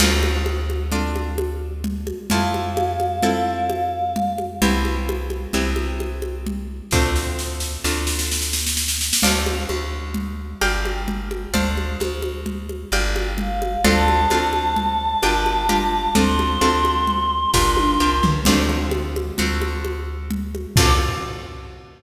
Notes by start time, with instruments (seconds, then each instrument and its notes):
0.00 electric bass (finger) D2, acoustic guitar (steel) C4 D4 F4 A4, crash, low conga
0.23 high conga
0.46 high conga
0.70 high conga
0.92 acoustic guitar (steel) C4 D4 F4 A4, low conga
1.16 high conga
1.38 high conga
1.84 low conga
2.07 high conga
2.30 electric bass (finger) F2, acoustic guitar (steel) C4 E4 F4 A4, choir aahs F5, low conga
2.54 high conga
2.77 high conga
3.00 high conga
3.22 acoustic guitar (steel) C4 E4 F4 A4, low conga
3.70 high conga
4.16 low conga
4.38 high conga
4.62 electric bass (finger) C2, acoustic guitar (steel) B3 C4 E4 G4, low conga
4.85 high conga
5.09 high conga
5.30 high conga
5.53 electric bass (finger) C2, acoustic guitar (steel) B3 C4 E4 G4, low conga
5.76 high conga
6.00 high conga
6.22 high conga
6.47 low conga
6.91 electric bass (finger) D2, acoustic guitar (steel) A3 C4 D4 F4, kick, snare
7.16 snare
7.39 snare
7.60 snare
7.84 electric bass (finger) D2, acoustic guitar (steel) A3 C4 D4 F4, snare
8.07 snare
8.19 snare
8.31 snare
8.42 snare
8.53 snare
8.67 snare
8.77 snare
8.88 snare
9.01 snare
9.13 snare
9.22 electric bass (finger) D2, acoustic guitar (steel) C5 D5 F5 A5, crash, low conga
9.46 high conga
9.69 electric bass (finger) D2, high conga
10.14 low conga
10.61 electric bass (finger) G1, acoustic guitar (steel) D5 F5 G5 A#5, high conga
10.85 high conga
11.08 low conga
11.31 high conga
11.54 electric bass (finger) D2, acoustic guitar (steel) C5 D5 F5 A5, low conga
11.77 high conga
12.00 electric bass (finger) D2, high conga
12.22 high conga
12.46 low conga
12.69 high conga
12.92 electric bass (finger) G1, acoustic guitar (steel) D5 F5 G5 A#5, high conga
13.16 high conga
13.38 choir aahs F5, low conga
13.62 high conga
13.84 electric bass (finger) D2, acoustic guitar (steel) C4 D4 F4 A4, choir aahs A5, low conga
14.08 high conga
14.30 electric bass (finger) D2, acoustic guitar (steel) C4 D4 F4 A4, high conga
14.53 high conga
14.76 low conga
15.22 electric bass (finger) G1, acoustic guitar (steel) D4 F4 G4 A#4, high conga
15.46 high conga
15.69 acoustic guitar (steel) D4 F4 G4 A#4, low conga
16.15 electric bass (finger) D2, acoustic guitar (steel) C4 D4 F4 A4, choir aahs C6, low conga
16.39 high conga
16.61 electric bass (finger) D2, acoustic guitar (steel) C4 D4 F4 A4, high conga
16.85 high conga
17.07 low conga
17.54 electric bass (finger) G1, acoustic guitar (steel) D4 F4 G4 A#4, kick, snare
17.77 high tom
18.00 electric bass (finger) C2, acoustic guitar (steel) D4 F4 G4 A#4
18.23 electric bass (finger) C#2, floor tom
18.45 electric bass (finger) D2, acoustic guitar (steel) A3 C4 D4 F4, crash, low conga
18.69 high conga
18.91 high conga
19.16 high conga
19.38 electric bass (finger) D2, acoustic guitar (steel) A3 C4 D4 F4, low conga
19.62 high conga
19.85 high conga
20.31 low conga
20.55 high conga
20.76 electric bass (finger) D2, acoustic guitar (steel) C4 D4 F4 A4, choir aahs D6, kick, crash